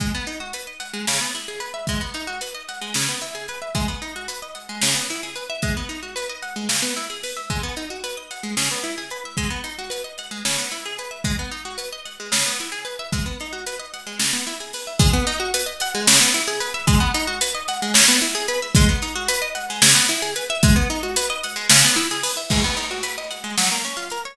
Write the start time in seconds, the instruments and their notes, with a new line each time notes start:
0.00 acoustic guitar (steel) G#3, kick, closed hi-hat
0.14 acoustic guitar (steel) B3
0.27 acoustic guitar (steel) D#4, closed hi-hat
0.40 acoustic guitar (steel) F#4
0.53 acoustic guitar (steel) B4, closed hi-hat
0.67 acoustic guitar (steel) D#5
0.80 acoustic guitar (steel) F#5, closed hi-hat
0.93 acoustic guitar (steel) G#3
1.07 acoustic guitar (steel) C#3, snare
1.21 acoustic guitar (steel) B3
1.34 acoustic guitar (steel) E4, closed hi-hat
1.48 acoustic guitar (steel) G#4
1.60 acoustic guitar (steel) B4, closed hi-hat
1.74 acoustic guitar (steel) E5
1.87 acoustic guitar (steel) G#3, kick, closed hi-hat
2.01 acoustic guitar (steel) B3
2.14 acoustic guitar (steel) D#4, closed hi-hat
2.27 acoustic guitar (steel) F#4
2.41 acoustic guitar (steel) B4, closed hi-hat
2.54 acoustic guitar (steel) D#5
2.68 acoustic guitar (steel) F#5, closed hi-hat
2.81 acoustic guitar (steel) G#3
2.94 acoustic guitar (steel) C#3, snare
3.08 acoustic guitar (steel) B3
3.21 acoustic guitar (steel) E4, closed hi-hat
3.35 acoustic guitar (steel) G#4
3.48 acoustic guitar (steel) B4, closed hi-hat
3.62 acoustic guitar (steel) E5
3.75 acoustic guitar (steel) G#3, kick, closed hi-hat
3.88 acoustic guitar (steel) B3
4.02 acoustic guitar (steel) D#4, closed hi-hat
4.16 acoustic guitar (steel) F#4
4.28 acoustic guitar (steel) B4, closed hi-hat
4.42 acoustic guitar (steel) D#5
4.55 acoustic guitar (steel) F#5, closed hi-hat
4.69 acoustic guitar (steel) G#3
4.81 acoustic guitar (steel) C#3, snare
4.95 acoustic guitar (steel) B3
5.08 acoustic guitar (steel) E4, closed hi-hat
5.23 acoustic guitar (steel) G#4
5.35 acoustic guitar (steel) B4, closed hi-hat
5.50 acoustic guitar (steel) E5
5.62 acoustic guitar (steel) G#3, kick, closed hi-hat
5.77 acoustic guitar (steel) B3
5.89 acoustic guitar (steel) D#4, closed hi-hat
6.02 acoustic guitar (steel) F#4
6.16 acoustic guitar (steel) B4, closed hi-hat
6.29 acoustic guitar (steel) D#5
6.42 acoustic guitar (steel) F#5, closed hi-hat
6.56 acoustic guitar (steel) G#3
6.69 acoustic guitar (steel) C#3, snare
6.82 acoustic guitar (steel) B3
6.96 acoustic guitar (steel) E4, closed hi-hat
7.10 acoustic guitar (steel) G#4
7.23 acoustic guitar (steel) B4, open hi-hat
7.36 acoustic guitar (steel) E5
7.50 acoustic guitar (steel) G#3, kick, closed hi-hat
7.63 acoustic guitar (steel) B3
7.76 acoustic guitar (steel) D#4, closed hi-hat
7.90 acoustic guitar (steel) F#4
8.04 acoustic guitar (steel) B4, closed hi-hat
8.17 acoustic guitar (steel) D#5
8.31 acoustic guitar (steel) F#5, closed hi-hat
8.43 acoustic guitar (steel) G#3
8.57 acoustic guitar (steel) C#3, snare
8.71 acoustic guitar (steel) B3
8.83 acoustic guitar (steel) E4, closed hi-hat
8.98 acoustic guitar (steel) G#4
9.10 acoustic guitar (steel) B4, closed hi-hat
9.25 acoustic guitar (steel) E5
9.37 acoustic guitar (steel) G#3, kick, closed hi-hat
9.50 acoustic guitar (steel) B3
9.64 acoustic guitar (steel) D#4, closed hi-hat
9.78 acoustic guitar (steel) F#4
9.90 acoustic guitar (steel) B4, closed hi-hat
10.04 acoustic guitar (steel) D#5
10.18 acoustic guitar (steel) F#5, closed hi-hat
10.31 acoustic guitar (steel) G#3
10.45 acoustic guitar (steel) C#3, snare
10.58 acoustic guitar (steel) B3
10.71 acoustic guitar (steel) E4, closed hi-hat
10.85 acoustic guitar (steel) G#4
10.98 acoustic guitar (steel) B4, closed hi-hat
11.11 acoustic guitar (steel) E5
11.24 acoustic guitar (steel) G#3, kick, closed hi-hat
11.39 acoustic guitar (steel) B3
11.51 acoustic guitar (steel) D#4, closed hi-hat
11.65 acoustic guitar (steel) F#4
11.78 acoustic guitar (steel) B4, closed hi-hat
11.92 acoustic guitar (steel) D#5
12.05 acoustic guitar (steel) F#5, closed hi-hat
12.20 acoustic guitar (steel) G#3
12.32 acoustic guitar (steel) C#3, snare
12.46 acoustic guitar (steel) B3
12.59 acoustic guitar (steel) E4, closed hi-hat
12.72 acoustic guitar (steel) G#4
12.85 acoustic guitar (steel) B4, closed hi-hat
12.99 acoustic guitar (steel) E5
13.12 acoustic guitar (steel) G#3, kick, closed hi-hat
13.26 acoustic guitar (steel) B3
13.40 acoustic guitar (steel) D#4, closed hi-hat
13.52 acoustic guitar (steel) F#4
13.66 acoustic guitar (steel) B4, closed hi-hat
13.79 acoustic guitar (steel) D#5
13.93 acoustic guitar (steel) F#5, closed hi-hat
14.06 acoustic guitar (steel) G#3
14.19 acoustic guitar (steel) C#3, snare
14.33 acoustic guitar (steel) B3
14.47 acoustic guitar (steel) E4, closed hi-hat
14.60 acoustic guitar (steel) G#4
14.73 acoustic guitar (steel) B4, open hi-hat
14.87 acoustic guitar (steel) E5
14.99 acoustic guitar (steel) G#3, kick, closed hi-hat
15.13 acoustic guitar (steel) B3
15.27 acoustic guitar (steel) D#4, closed hi-hat
15.40 acoustic guitar (steel) F#4
15.54 acoustic guitar (steel) B4, closed hi-hat
15.66 acoustic guitar (steel) D#5
15.80 acoustic guitar (steel) F#5, closed hi-hat
15.94 acoustic guitar (steel) G#3
16.07 acoustic guitar (steel) C#3, snare
16.21 acoustic guitar (steel) B3
16.34 acoustic guitar (steel) E4, closed hi-hat
16.47 acoustic guitar (steel) G#4
16.60 acoustic guitar (steel) B4, closed hi-hat
16.74 acoustic guitar (steel) E5
16.87 acoustic guitar (steel) G#3, kick, closed hi-hat
17.00 acoustic guitar (steel) B3
17.14 acoustic guitar (steel) D#4, closed hi-hat
17.27 acoustic guitar (steel) F#4
17.41 acoustic guitar (steel) B4, closed hi-hat
17.54 acoustic guitar (steel) D#5
17.68 acoustic guitar (steel) F#5, closed hi-hat
17.82 acoustic guitar (steel) G#3
17.94 acoustic guitar (steel) C#3, snare
18.08 acoustic guitar (steel) B3
18.21 acoustic guitar (steel) E4, closed hi-hat
18.35 acoustic guitar (steel) G#4
18.48 acoustic guitar (steel) B4, closed hi-hat
18.62 acoustic guitar (steel) E5
18.75 acoustic guitar (steel) G#3, kick, closed hi-hat
18.89 acoustic guitar (steel) B3
19.02 acoustic guitar (steel) D#4, closed hi-hat
19.15 acoustic guitar (steel) F#4
19.28 acoustic guitar (steel) B4, closed hi-hat
19.42 acoustic guitar (steel) D#5
19.55 acoustic guitar (steel) F#5, closed hi-hat
19.70 acoustic guitar (steel) G#3
19.82 acoustic guitar (steel) C#3, snare
19.95 acoustic guitar (steel) B3
20.09 acoustic guitar (steel) E4, closed hi-hat
20.22 acoustic guitar (steel) G#4
20.36 acoustic guitar (steel) B4, closed hi-hat
20.50 acoustic guitar (steel) E5
20.63 acoustic guitar (steel) G#3, kick, closed hi-hat
20.76 acoustic guitar (steel) B3
20.90 acoustic guitar (steel) D#4, closed hi-hat
21.03 acoustic guitar (steel) F#4
21.16 acoustic guitar (steel) B4, closed hi-hat
21.30 acoustic guitar (steel) D#5
21.43 acoustic guitar (steel) F#5, closed hi-hat
21.56 acoustic guitar (steel) G#3
21.69 acoustic guitar (steel) C#3, snare
21.84 acoustic guitar (steel) B3
21.96 acoustic guitar (steel) E4, closed hi-hat
22.11 acoustic guitar (steel) G#4
22.23 acoustic guitar (steel) B4, open hi-hat
22.37 acoustic guitar (steel) E5
22.50 acoustic guitar (steel) G#3, kick, crash
22.64 acoustic guitar (steel) B3
22.77 acoustic guitar (steel) D#4, closed hi-hat
22.91 acoustic guitar (steel) F#4
23.03 acoustic guitar (steel) B4, closed hi-hat
23.18 acoustic guitar (steel) D#5
23.30 acoustic guitar (steel) F#5, closed hi-hat
23.44 acoustic guitar (steel) G#3
23.58 acoustic guitar (steel) F#3, snare
23.71 acoustic guitar (steel) A#3
23.84 acoustic guitar (steel) C#4, closed hi-hat
23.97 acoustic guitar (steel) F4
24.10 acoustic guitar (steel) A#4, closed hi-hat
24.25 acoustic guitar (steel) C#5